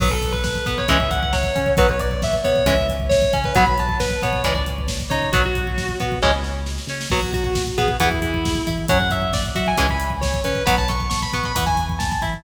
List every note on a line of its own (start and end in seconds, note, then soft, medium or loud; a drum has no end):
0.00 0.56 B1 medium
0.00 0.09 F#3 medium
0.00 0.09 B3 medium
0.00 0.12 B4 loud
0.00 kick loud
0.00 crash loud
0.11 0.31 A4 medium
0.11 kick medium
0.22 kick medium
0.22 closed hi-hat medium
0.32 0.43 B4 medium
0.32 kick medium
0.44 0.65 B4 medium
0.44 kick medium
0.44 snare loud
0.55 kick medium
0.66 0.86 B2 medium
0.66 0.85 B3 medium
0.66 0.78 B4 medium
0.66 kick medium
0.66 closed hi-hat medium
0.78 0.89 C#5 loud
0.78 kick medium
0.88 1.45 C#2 medium
0.88 0.97 E3 medium
0.88 0.97 G#3 medium
0.88 0.97 C#4 medium
0.88 1.10 E5 medium
0.88 kick loud
0.88 closed hi-hat loud
1.00 kick loud
1.11 1.21 F#5 medium
1.11 kick medium
1.11 closed hi-hat medium
1.23 1.33 F#5 medium
1.23 kick medium
1.33 1.70 C#5 loud
1.33 kick medium
1.33 snare loud
1.43 kick medium
1.55 1.75 C#3 medium
1.55 1.74 C#4 medium
1.55 kick medium
1.55 closed hi-hat medium
1.66 kick medium
1.77 2.34 B1 medium
1.77 1.87 F#3 medium
1.77 1.87 B3 medium
1.77 1.89 B4 loud
1.77 kick loud
1.77 closed hi-hat loud
1.89 2.00 C#5 medium
1.89 kick medium
2.00 2.21 D5 medium
2.00 kick medium
2.00 closed hi-hat medium
2.11 kick medium
2.22 2.34 E5 medium
2.22 kick loud
2.22 snare loud
2.33 kick medium
2.44 2.63 B2 medium
2.44 2.63 B3 medium
2.44 2.65 C#5 medium
2.44 kick medium
2.44 closed hi-hat medium
2.56 kick medium
2.65 3.22 C#2 medium
2.65 2.75 E3 medium
2.65 2.75 G#3 medium
2.65 2.75 C#4 medium
2.65 2.86 E5 medium
2.65 kick loud
2.65 closed hi-hat loud
2.79 kick medium
2.89 kick medium
2.89 closed hi-hat medium
3.00 kick medium
3.09 3.37 C#5 loud
3.09 kick loud
3.09 snare loud
3.22 kick loud
3.33 3.52 C#3 medium
3.33 3.52 C#4 medium
3.33 kick loud
3.33 closed hi-hat medium
3.44 3.56 B4 medium
3.44 kick loud
3.55 4.12 B1 medium
3.55 3.64 F#3 medium
3.55 3.64 B3 medium
3.55 3.66 B5 loud
3.55 kick loud
3.55 closed hi-hat loud
3.66 3.77 B5 medium
3.66 kick medium
3.78 3.97 A5 medium
3.78 kick medium
3.78 closed hi-hat medium
3.89 kick medium
4.00 4.21 B4 medium
4.00 kick medium
4.00 snare loud
4.10 kick medium
4.22 4.42 B2 medium
4.22 4.41 B3 medium
4.22 4.43 C#5 medium
4.22 kick medium
4.22 closed hi-hat medium
4.33 kick medium
4.44 5.01 C#2 medium
4.44 4.53 E3 medium
4.44 4.53 G#3 medium
4.44 4.53 C#4 medium
4.44 4.54 D5 medium
4.44 kick medium
4.44 closed hi-hat loud
4.55 4.65 D5 medium
4.55 kick medium
4.66 kick medium
4.66 closed hi-hat medium
4.78 kick medium
4.88 kick medium
4.88 snare loud
5.00 kick medium
5.10 5.29 C#3 medium
5.10 5.30 D#4 medium
5.10 5.28 C#5 medium
5.10 kick medium
5.10 closed hi-hat medium
5.22 kick medium
5.32 5.90 B1 medium
5.32 5.42 F#3 medium
5.32 5.42 B3 medium
5.32 5.43 F#4 loud
5.32 kick loud
5.32 closed hi-hat loud
5.44 5.96 F#4 loud
5.44 kick medium
5.55 kick medium
5.55 closed hi-hat medium
5.67 kick medium
5.78 kick medium
5.78 snare loud
5.89 kick medium
6.00 6.20 B2 medium
6.00 6.19 B3 medium
6.00 kick medium
6.00 closed hi-hat medium
6.12 kick medium
6.22 6.79 C#2 medium
6.22 6.31 E3 loud
6.22 6.31 G#3 medium
6.22 6.31 C#4 loud
6.22 kick medium
6.22 snare medium
6.44 snare medium
6.66 snare medium
6.78 snare medium
6.87 7.06 C#3 medium
6.87 7.08 C#4 medium
6.87 snare medium
7.01 snare loud
7.10 7.67 B1 medium
7.10 7.20 F#3 medium
7.10 7.20 B3 medium
7.10 7.31 F#4 loud
7.10 kick loud
7.10 crash medium
7.23 kick medium
7.33 7.44 F#4 loud
7.33 kick medium
7.33 closed hi-hat medium
7.44 7.62 F#4 medium
7.44 kick medium
7.55 kick loud
7.55 snare loud
7.67 kick medium
7.78 7.97 B2 medium
7.78 7.97 B3 medium
7.78 7.88 G#4 medium
7.78 kick medium
7.78 closed hi-hat medium
7.88 kick medium
7.99 8.56 E2 medium
7.99 8.09 E3 medium
7.99 8.09 B3 medium
7.99 8.19 E4 medium
7.99 kick loud
7.99 closed hi-hat loud
8.12 kick medium
8.22 8.62 E4 medium
8.22 kick medium
8.22 closed hi-hat medium
8.34 kick medium
8.45 kick loud
8.45 snare loud
8.55 kick medium
8.67 8.87 E3 medium
8.67 8.86 E4 medium
8.67 kick medium
8.67 closed hi-hat medium
8.78 kick medium
8.88 9.46 F#2 medium
8.88 8.98 F#3 medium
8.88 8.98 C#4 medium
8.88 9.11 F#5 loud
8.88 kick loud
8.88 closed hi-hat loud
9.00 kick medium
9.10 9.30 E5 medium
9.10 kick medium
9.10 closed hi-hat medium
9.22 kick medium
9.33 9.44 D5 medium
9.33 kick loud
9.33 snare loud
9.46 kick medium
9.55 9.74 F#3 medium
9.55 9.75 F#4 medium
9.55 9.66 E5 loud
9.55 kick medium
9.55 closed hi-hat medium
9.67 9.78 G#5 loud
9.67 kick medium
9.77 10.36 C#2 medium
9.77 9.87 E3 medium
9.77 9.87 G#3 medium
9.77 9.87 C#4 medium
9.77 9.89 G#5 medium
9.77 kick medium
9.77 closed hi-hat loud
9.89 10.10 B5 medium
9.89 kick medium
10.00 closed hi-hat medium
10.10 kick medium
10.21 10.40 C#5 medium
10.21 kick medium
10.21 snare loud
10.34 kick medium
10.44 10.62 C#3 medium
10.44 10.64 C#4 medium
10.44 10.63 B4 loud
10.44 kick medium
10.44 closed hi-hat medium
10.55 kick medium
10.66 11.24 B1 medium
10.66 10.75 F#3 medium
10.66 10.75 B3 medium
10.66 10.76 B5 loud
10.66 kick loud
10.66 closed hi-hat loud
10.78 10.89 A5 loud
10.78 kick medium
10.88 11.08 C#6 medium
10.88 kick medium
10.88 closed hi-hat medium
11.00 kick medium
11.10 11.20 C#6 loud
11.10 kick medium
11.10 snare loud
11.22 11.33 B5 medium
11.22 kick medium
11.33 11.52 B2 medium
11.33 11.52 B3 medium
11.33 11.45 C#6 medium
11.33 kick medium
11.33 closed hi-hat medium
11.44 11.55 B5 medium
11.44 kick medium
11.55 12.11 E2 medium
11.55 11.65 E3 medium
11.55 11.65 B3 medium
11.55 11.66 B5 loud
11.55 kick loud
11.55 closed hi-hat loud
11.66 11.85 G#5 loud
11.66 kick medium
11.77 kick medium
11.77 closed hi-hat medium
11.89 kick medium
11.99 12.09 A5 medium
11.99 kick loud
11.99 snare loud
12.12 12.22 A5 medium
12.12 kick medium
12.22 12.41 E3 medium
12.22 12.41 E4 medium
12.22 12.33 B5 medium
12.22 kick medium
12.22 closed hi-hat medium
12.34 kick medium